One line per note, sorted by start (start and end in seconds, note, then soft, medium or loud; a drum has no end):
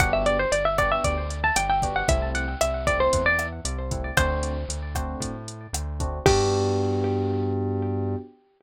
0.00 0.46 G1 medium
0.00 0.37 B3 medium
0.00 0.37 D4 medium
0.00 0.37 F#4 medium
0.00 0.37 G4 medium
0.00 0.12 F#5 loud
0.00 kick loud
0.00 cross-stick loud
0.00 closed hi-hat medium
0.13 0.25 E5 medium
0.26 0.38 D5 medium
0.26 closed hi-hat medium
0.39 0.52 C5 medium
0.52 0.99 G1 medium
0.52 0.64 D5 medium
0.52 closed hi-hat loud
0.65 0.78 E5 medium
0.78 1.15 B3 medium
0.78 1.15 D4 medium
0.78 1.15 F#4 medium
0.78 1.15 G4 medium
0.78 0.91 D5 medium
0.78 kick medium
0.78 cross-stick medium
0.78 closed hi-hat medium
0.92 1.04 E5 loud
1.04 1.51 D2 medium
1.04 1.39 D5 medium
1.04 kick medium
1.04 closed hi-hat medium
1.30 closed hi-hat medium
1.44 1.56 A5 medium
1.56 2.03 G1 medium
1.56 1.69 G5 medium
1.56 cross-stick medium
1.56 closed hi-hat loud
1.69 1.95 G5 medium
1.82 2.01 B3 medium
1.82 2.01 D4 medium
1.82 2.01 F#4 medium
1.82 2.01 G4 medium
1.82 kick medium
1.82 closed hi-hat medium
1.96 2.08 F#5 medium
2.08 2.55 C2 medium
2.08 2.45 A3 medium
2.08 2.45 C4 medium
2.08 2.45 E4 medium
2.08 2.30 E5 loud
2.08 kick medium
2.08 closed hi-hat loud
2.35 2.59 F#5 medium
2.35 closed hi-hat medium
2.61 3.08 C2 medium
2.61 2.86 E5 medium
2.61 cross-stick medium
2.61 closed hi-hat loud
2.87 3.24 A3 medium
2.87 3.24 C4 medium
2.87 3.24 E4 medium
2.87 2.99 D5 medium
2.87 kick medium
2.87 closed hi-hat medium
3.00 3.24 C5 medium
3.13 3.60 E2 medium
3.13 kick medium
3.13 closed hi-hat loud
3.26 3.47 D5 loud
3.39 cross-stick medium
3.39 closed hi-hat medium
3.65 4.12 C2 medium
3.65 closed hi-hat loud
3.91 4.10 A3 medium
3.91 4.10 C4 medium
3.91 4.10 E4 medium
3.91 kick medium
3.91 closed hi-hat medium
4.17 4.64 D2 medium
4.17 4.54 A3 medium
4.17 4.54 C4 medium
4.17 4.54 D4 medium
4.17 4.54 F#4 medium
4.17 4.94 C5 loud
4.17 kick medium
4.17 cross-stick medium
4.17 closed hi-hat loud
4.43 closed hi-hat medium
4.68 5.15 D2 medium
4.68 closed hi-hat medium
4.95 5.32 A3 medium
4.95 5.32 C4 medium
4.95 5.32 D4 medium
4.95 5.32 F#4 medium
4.95 kick medium
4.95 cross-stick medium
4.95 closed hi-hat medium
5.20 5.67 A2 medium
5.20 kick medium
5.20 closed hi-hat medium
5.48 closed hi-hat medium
5.73 6.20 D2 medium
5.73 cross-stick medium
5.73 closed hi-hat loud
6.00 6.18 A3 medium
6.00 6.18 C4 medium
6.00 6.18 D4 medium
6.00 6.18 F#4 medium
6.00 kick medium
6.00 closed hi-hat medium
6.26 8.16 G2 loud
6.26 8.16 B3 loud
6.26 8.16 D4 loud
6.26 8.16 F#4 loud
6.26 8.15 G4 loud
6.26 8.16 G4 loud
6.26 kick loud
6.26 crash loud